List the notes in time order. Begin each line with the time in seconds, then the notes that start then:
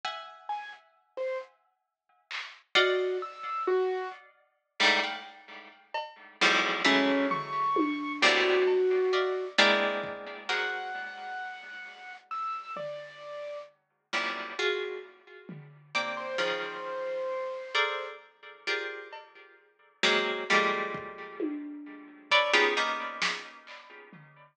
0.05 E5 F#5 G#5
0.49 G#5
1.17 C5
2.31 clap
2.75 F#4 D5 D#5 F5 F#5
3.22 E6
3.67 F#4
4.80 G2 G#2 A2
5.03 F5 F#5 G5
5.94 cowbell
6.41 E2 F2 F#2 G#2
6.84 E3 F#3 G#3 A3 C#4
7.30 C#6, floor tom
7.76 high tom
8.22 A2 A#2 B2 C3 D3 F#4
8.67 cowbell
9.13 D5 D#5 E5 F5
9.58 G#3 A#3 B3 C4 D4 E4, closed hi-hat
10.03 kick
10.49 F#4 G#4 A#4 C5 F#5, clap
12.30 E6
12.76 D5, floor tom
14.13 F#2 G2 A2 A#2 C3
14.59 F4 F#4 G#4
15.49 floor tom
15.95 A#3 C4 D4
16.17 C5
16.38 C#3 D#3 F3 C5
17.74 G#4 A4 A#4 C5 D5
18.67 F4 G4 G#4 A#4 C5 D5
19.13 cowbell
20.03 F#3 G#3 A#3 C4 C#4, snare
20.50 F3 G3 G#3 A3 A#3
20.94 kick
21.40 high tom
22.31 A4 B4 C#5 D5, kick
22.53 B3 C#4 D#4 F4 G4 G#4
22.77 A#3 B3 C#4 D#4
23.22 snare
23.67 clap
24.13 floor tom